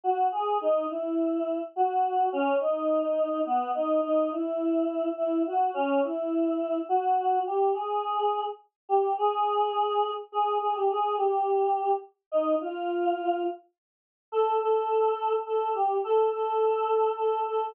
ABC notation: X:1
M:3/4
L:1/16
Q:1/4=105
K:F#mix
V:1 name="Choir Aahs"
F2 G2 | D2 E6 F4 | C2 D6 B,2 D2 | D2 E6 E2 F2 |
C2 E6 F4 | [K:Ebmix] G2 A6 z2 G2 | A8 A2 A G | A2 G6 z2 E2 |
F6 z6 | [K:Fmix] A2 A6 A2 G2 | A2 A6 A2 A2 |]